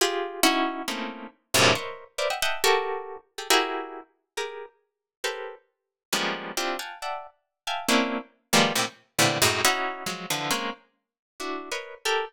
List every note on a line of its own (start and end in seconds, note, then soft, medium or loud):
0.01 0.40 F4 loud
0.01 0.40 G4 loud
0.01 0.40 G#4 loud
0.43 0.83 C#4 loud
0.43 0.83 D#4 loud
0.43 0.83 E4 loud
0.43 0.83 F#4 loud
0.88 1.47 A3 medium
0.88 1.47 A#3 medium
0.88 1.47 C4 medium
0.88 1.47 C#4 medium
0.88 1.47 D#4 medium
0.88 1.47 E4 medium
1.54 1.74 F#2 loud
1.54 1.74 G2 loud
1.54 1.74 A2 loud
1.54 1.74 A#2 loud
1.54 1.74 C3 loud
1.54 1.74 C#3 loud
1.75 2.15 A#4 medium
1.75 2.15 B4 medium
1.75 2.15 C5 medium
1.75 2.15 C#5 medium
1.75 2.15 D#5 medium
1.75 2.15 E5 medium
2.18 2.28 A#4 medium
2.18 2.28 B4 medium
2.18 2.28 C5 medium
2.18 2.28 D5 medium
2.18 2.28 E5 medium
2.30 2.40 D#5 medium
2.30 2.40 E5 medium
2.30 2.40 F#5 medium
2.30 2.40 G5 medium
2.42 2.62 D#5 loud
2.42 2.62 E5 loud
2.42 2.62 F#5 loud
2.42 2.62 G5 loud
2.42 2.62 A5 loud
2.64 3.23 F#4 loud
2.64 3.23 G4 loud
2.64 3.23 A4 loud
2.64 3.23 A#4 loud
3.38 3.48 G4 medium
3.38 3.48 G#4 medium
3.38 3.48 A4 medium
3.50 4.29 E4 loud
3.50 4.29 F#4 loud
3.50 4.29 G4 loud
3.50 4.29 G#4 loud
3.50 4.29 A#4 loud
4.37 5.16 G4 medium
4.37 5.16 G#4 medium
4.37 5.16 A#4 medium
5.24 6.03 G4 medium
5.24 6.03 A4 medium
5.24 6.03 A#4 medium
5.24 6.03 B4 medium
5.24 6.03 C5 medium
6.12 6.52 F3 medium
6.12 6.52 G3 medium
6.12 6.52 G#3 medium
6.12 6.52 A#3 medium
6.12 6.52 B3 medium
6.12 6.52 C#4 medium
6.57 6.77 C4 medium
6.57 6.77 D4 medium
6.57 6.77 E4 medium
6.57 6.77 F4 medium
6.57 6.77 G4 medium
6.79 6.99 F5 medium
6.79 6.99 F#5 medium
6.79 6.99 G5 medium
6.79 6.99 G#5 medium
6.79 6.99 A5 medium
7.02 7.61 D5 medium
7.02 7.61 E5 medium
7.02 7.61 F#5 medium
7.02 7.61 G5 medium
7.02 7.61 A5 medium
7.67 7.87 E5 medium
7.67 7.87 F5 medium
7.67 7.87 G5 medium
7.67 7.87 G#5 medium
7.67 7.87 A5 medium
7.89 8.18 A#3 loud
7.89 8.18 C4 loud
7.89 8.18 C#4 loud
7.89 8.18 D4 loud
7.89 8.18 E4 loud
8.53 8.73 D#3 loud
8.53 8.73 F3 loud
8.53 8.73 G3 loud
8.53 8.73 G#3 loud
8.53 8.73 A#3 loud
8.53 8.73 B3 loud
8.75 8.85 A2 medium
8.75 8.85 A#2 medium
8.75 8.85 C3 medium
9.19 9.38 A2 medium
9.19 9.38 A#2 medium
9.19 9.38 C3 medium
9.19 9.38 D3 medium
9.19 9.38 E3 medium
9.42 9.61 F#2 loud
9.42 9.61 G#2 loud
9.42 9.61 A2 loud
9.65 10.04 C#4 loud
9.65 10.04 D#4 loud
9.65 10.04 E4 loud
9.65 10.04 F#4 loud
10.06 10.26 F3 medium
10.06 10.26 F#3 medium
10.06 10.26 G#3 medium
10.30 10.50 D3 medium
10.30 10.50 E3 medium
10.30 10.50 F3 medium
10.51 10.70 G#3 medium
10.51 10.70 A#3 medium
10.51 10.70 C4 medium
10.51 10.70 C#4 medium
11.40 11.69 D4 medium
11.40 11.69 E4 medium
11.40 11.69 F#4 medium
11.71 12.01 A#4 medium
11.71 12.01 B4 medium
11.71 12.01 C#5 medium
11.71 12.01 D#5 medium
12.05 12.25 G4 loud
12.05 12.25 A4 loud
12.05 12.25 A#4 loud